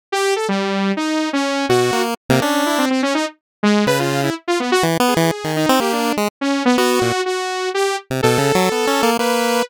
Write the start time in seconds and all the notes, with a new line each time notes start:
0.12 G4
0.36 A4
0.48 G3
0.97 D#4
1.33 C#4
1.69 B2 F#4
1.93 A#3
2.29 C3 A#3
2.42 C#4 D4
2.66 E4
2.78 C4
2.90 C4
3.03 C#4
3.15 D#4
3.63 G#3
3.87 C#3 B4
3.99 F4
4.23 E4
4.48 F4
4.60 B3
4.72 F#4
4.83 E3
5.00 B3
5.08 G#4
5.17 E3
5.44 D#3
5.56 D#4
5.69 C4
5.80 A#3 G4
5.93 D4
6.17 G#3
6.41 C#4
6.65 B3
6.78 B3 F#4
7.01 A#2
7.26 F#4
7.74 G4
8.10 C3
8.23 B2 A4
8.38 C#3
8.55 F#3
8.72 B3
8.87 C#4
9.03 A#3
9.19 A#3 B4